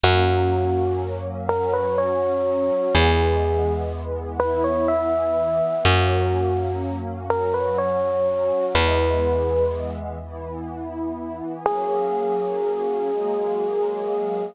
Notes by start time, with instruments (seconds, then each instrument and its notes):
0.03 electric bass (finger) F#2, pad 5 (bowed) F#3 A#3 C#4, electric piano 1 F#4
1.49 pad 5 (bowed) F#3 C#4 F#4, electric piano 1 A#4
1.73 electric piano 1 B4
1.98 electric piano 1 C#5
2.95 electric bass (finger) E2, pad 5 (bowed) E3 G#3 B3, electric piano 1 G#4
4.40 pad 5 (bowed) E3 B3 E4, electric piano 1 B4
4.64 electric piano 1 C#5
4.88 electric piano 1 E5
5.85 electric bass (finger) F#2, pad 5 (bowed) F#3 A#3 C#4, electric piano 1 F#4
7.29 pad 5 (bowed) F#3 C#4 F#4, electric piano 1 A#4
7.54 electric piano 1 B4
7.78 electric piano 1 C#5
8.74 electric bass (finger) E2, pad 5 (bowed) E3 G#3 B3, electric piano 1 B4
10.22 pad 5 (bowed) E3 B3 E4
11.66 pad 5 (bowed) F#3 A#3 C#4 G#4, electric piano 1 G#4
13.10 pad 5 (bowed) F#3 G#3 A#3 G#4